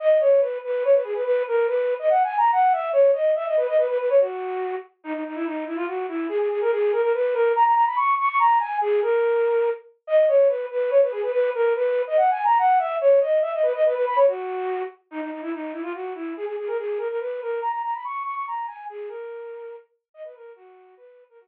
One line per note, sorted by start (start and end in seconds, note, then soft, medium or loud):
0.00 0.18 D#5 medium
0.20 0.40 C#5 medium
0.41 0.58 B4 medium
0.64 0.83 B4 medium
0.85 0.95 C#5 medium
0.94 1.04 B4 medium
1.04 1.14 G#4 medium
1.14 1.24 B4 medium
1.25 1.43 B4 medium
1.47 1.66 A#4 medium
1.68 1.94 B4 medium
1.99 2.09 D#5 medium
2.10 2.23 F#5 medium
2.24 2.37 G#5 medium
2.38 2.51 A#5 medium
2.52 2.73 F#5 medium
2.72 2.89 E5 medium
2.93 3.11 C#5 medium
3.13 3.31 D#5 medium
3.35 3.45 E5 medium
3.46 3.56 D#5 medium
3.57 3.67 B4 medium
3.67 3.77 D#5 medium
3.77 3.87 B4 medium
3.88 3.98 B4 medium
3.99 4.09 B4 medium
4.10 4.20 C#5 medium
4.20 4.75 F#4 medium
5.04 5.13 D#4 medium
5.13 5.23 D#4 medium
5.26 5.36 D#4 medium
5.35 5.45 E4 medium
5.45 5.64 D#4 medium
5.66 5.76 E4 medium
5.76 5.86 F4 medium
5.87 6.06 F#4 medium
6.08 6.26 E4 medium
6.29 6.38 G#4 medium
6.39 6.49 G#4 medium
6.50 6.60 G#4 medium
6.61 6.71 A#4 medium
6.72 6.92 G#4 medium
6.92 7.02 A#4 medium
7.02 7.12 A#4 medium
7.14 7.35 B4 medium
7.34 7.52 A#4 medium
7.56 7.64 A#5 medium
7.65 7.74 A#5 medium
7.75 7.85 A#5 medium
7.87 7.97 B5 medium
7.96 8.15 C#6 medium
8.19 8.28 C#6 medium
8.29 8.39 C#6 medium
8.39 8.58 A#5 medium
8.59 8.78 G#5 medium
8.81 9.00 G#4 medium
9.02 9.69 A#4 medium
10.07 10.25 D#5 medium
10.28 10.48 C#5 medium
10.49 10.66 B4 medium
10.71 10.90 B4 medium
10.91 11.01 C#5 medium
11.02 11.12 B4 medium
11.12 11.22 G#4 medium
11.22 11.32 B4 medium
11.32 11.50 B4 medium
11.54 11.73 A#4 medium
11.76 12.02 B4 medium
12.07 12.17 D#5 medium
12.17 12.30 F#5 medium
12.31 12.44 G#5 medium
12.45 12.58 A#5 medium
12.58 12.79 F#5 medium
12.79 12.96 E5 medium
13.01 13.19 C#5 medium
13.21 13.38 D#5 medium
13.42 13.52 E5 medium
13.53 13.63 D#5 medium
13.63 13.73 B4 medium
13.74 13.84 D#5 medium
13.86 13.95 B4 medium
13.95 14.05 B4 medium
14.07 14.17 B5 medium
14.16 14.26 C#5 medium
14.27 14.83 F#4 medium
15.11 15.21 D#4 medium
15.21 15.31 D#4 medium
15.31 15.41 D#4 medium
15.42 15.52 E4 medium
15.53 15.72 D#4 medium
15.72 15.82 E4 medium
15.82 15.92 F4 medium
15.94 16.13 F#4 medium
16.15 16.33 E4 medium
16.37 16.45 G#4 medium
16.46 16.56 G#4 medium
16.58 16.68 G#4 medium
16.67 16.77 A#4 medium
16.78 16.98 G#4 medium
16.98 17.08 A#4 medium
17.09 17.19 A#4 medium
17.20 17.41 B4 medium
17.42 17.60 A#4 medium
17.62 17.71 A#5 medium
17.72 17.82 A#5 medium
17.84 17.94 A#5 medium
17.94 18.04 B5 medium
18.05 18.23 C#6 medium
18.24 18.34 C#6 medium
18.35 18.45 C#6 medium
18.47 18.66 A#5 medium
18.67 18.85 G#5 medium
18.89 19.09 G#4 medium
19.08 19.76 A#4 medium
20.14 20.24 D#5 medium
20.24 20.34 B4 medium
20.35 20.52 A#4 medium
20.56 20.95 F#4 medium
20.97 21.24 B4 medium
21.29 21.39 A#4 medium
21.40 21.47 F#4 medium